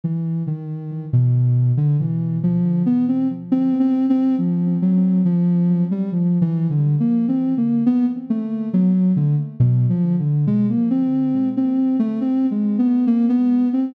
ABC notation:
X:1
M:2/4
L:1/16
Q:1/4=69
K:none
V:1 name="Ocarina"
E,2 ^D,3 B,,3 | D, E,2 F,2 B, C z | (3C2 C2 C2 F,2 ^F,2 | F,3 G, (3F,2 E,2 D,2 |
(3^A,2 C2 A,2 B, z =A,2 | ^F,2 D, z (3B,,2 =F,2 D,2 | ^G, ^A, C3 C2 =A, | (3C2 ^G,2 B,2 ^A, B,2 C |]